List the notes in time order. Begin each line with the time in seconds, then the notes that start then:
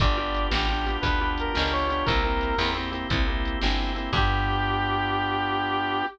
0.00 G1 B3 D4 F4 G4 D5, kick, closed hi-hat
0.17 B3 D4 F4 G4
0.34 closed hi-hat
0.51 A1 B3 D4 F4 G4, snare
0.69 B3 D4 F4 G4
0.86 B3 D4 F4 G4, closed hi-hat
1.01 D2 B3 D4 F4 G4 B4, kick, closed hi-hat
1.21 B3 D4 F4 G4
1.38 A#4, closed hi-hat
1.54 C#2 B3 D4 F4 G4, snare
1.72 C#5
1.89 B3 D4 F4 G4, closed hi-hat
2.06 C2 A#3 C4 E4 G4 A#4, kick, closed hi-hat
2.23 A#3 C4 E4 G4
2.41 closed hi-hat
2.58 E2 A#3 C4 E4 G4, snare
2.75 A#3 C4 E4 G4
2.92 A#3 C4 E4 G4, closed hi-hat
3.10 C2 A#3 C4 E4 G4, kick, closed hi-hat
3.27 A#3 C4 E4 G4
3.45 closed hi-hat
3.61 G1 A#3 C4 E4 G4, snare
3.95 A#3 C4 E4 G4, closed hi-hat
4.13 G2 B3 D4 F4 G4, kick, crash